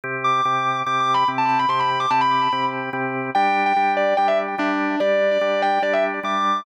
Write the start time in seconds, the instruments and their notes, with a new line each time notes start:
0.04 drawbar organ C3 C4 G4
0.24 distortion guitar D6
0.45 drawbar organ C3 C4 G4
0.86 drawbar organ C3 C4 G4, distortion guitar D6
1.00 distortion guitar D6
1.14 distortion guitar B5
1.28 drawbar organ C3 C4 G4
1.38 distortion guitar A5
1.49 distortion guitar A5
1.59 distortion guitar B5
1.69 drawbar organ C3 C4 G4, distortion guitar C6
1.79 distortion guitar B5
2.00 distortion guitar D6
2.10 drawbar organ C3 C4 G4, distortion guitar A5
2.21 distortion guitar B5
2.52 drawbar organ C3 C4 G4
2.93 drawbar organ C3 C4 G4
3.35 drawbar organ G3 D4 G4, distortion guitar G5
3.66 distortion guitar G5
3.76 drawbar organ G3 D4 G4
3.97 distortion guitar D5
4.17 drawbar organ G3 D4 G4, distortion guitar G5
4.28 distortion guitar E5
4.58 drawbar organ G3 D4 G4, distortion guitar D4
5.00 drawbar organ G3 D4 G4, distortion guitar D5
5.31 distortion guitar D5
5.41 drawbar organ G3 D4 G4
5.62 distortion guitar G5
5.82 drawbar organ G3 D4 G4, distortion guitar D5
5.93 distortion guitar E5
6.23 drawbar organ G3 D4 G4, distortion guitar D6